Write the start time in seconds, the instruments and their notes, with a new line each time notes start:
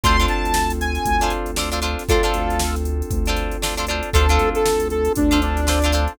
0.04 synth bass 1 D2, electric piano 2 C4 D4 F4 A4, acoustic guitar (steel) D4 F4 A4 C5, lead 2 (sawtooth) C6, kick, closed hi-hat
0.20 acoustic guitar (steel) D4 F4 A4 C5, closed hi-hat
0.28 synth bass 1 D2, lead 2 (sawtooth) A5, closed hi-hat
0.45 closed hi-hat
0.54 snare
0.70 closed hi-hat
0.81 lead 2 (sawtooth) G#5, closed hi-hat
0.95 snare, closed hi-hat
1.05 synth bass 1 D2, kick, closed hi-hat
1.21 acoustic guitar (steel) D4 F4 A4 C5, closed hi-hat
1.30 closed hi-hat
1.46 closed hi-hat
1.56 acoustic guitar (steel) D4 F4 A4 C5, snare
1.72 acoustic guitar (steel) D4 F4 A4 C5, closed hi-hat
1.82 acoustic guitar (steel) D4 F4 A4 C5, closed hi-hat
1.99 snare, closed hi-hat
2.09 synth bass 1 D2, electric piano 2 C4 D4 F4 A4, acoustic guitar (steel) D4 F4 A4 C5, lead 2 (sawtooth) F4 A4, kick, closed hi-hat
2.23 acoustic guitar (steel) D4 F4 A4 C5, closed hi-hat
2.34 synth bass 1 D2, closed hi-hat
2.50 closed hi-hat
2.60 snare
2.76 closed hi-hat
2.85 closed hi-hat
3.02 closed hi-hat
3.11 synth bass 1 D2, kick, closed hi-hat
3.26 acoustic guitar (steel) D4 F4 A4, snare, closed hi-hat
3.30 acoustic guitar (steel) C5
3.37 snare, closed hi-hat
3.51 closed hi-hat
3.62 acoustic guitar (steel) D4 F4 A4 C5, snare
3.77 acoustic guitar (steel) D4 F4 A4 C5, closed hi-hat
3.87 acoustic guitar (steel) D4 F4 A4, closed hi-hat
3.91 acoustic guitar (steel) C5
4.03 closed hi-hat
4.13 synth bass 1 D2, electric piano 2 C4 D4 F4 A4, acoustic guitar (steel) D4 F4 A4 C5, lead 2 (sawtooth) A4, kick, closed hi-hat
4.29 acoustic guitar (steel) D4 F4 A4 C5, closed hi-hat
4.39 synth bass 1 D2, closed hi-hat
4.55 lead 2 (sawtooth) A4, closed hi-hat
4.66 snare
4.80 closed hi-hat
4.90 lead 2 (sawtooth) A4, closed hi-hat
5.05 closed hi-hat
5.15 synth bass 1 D2, lead 2 (sawtooth) D4, kick, closed hi-hat
5.31 acoustic guitar (steel) D4 F4 A4 C5, closed hi-hat
5.42 lead 2 (sawtooth) D4, closed hi-hat
5.57 snare, closed hi-hat
5.67 acoustic guitar (steel) D4 F4 A4 C5, snare
5.82 acoustic guitar (steel) D4 F4 A4 C5, closed hi-hat
5.92 acoustic guitar (steel) D4 F4 A4 C5, closed hi-hat
6.08 closed hi-hat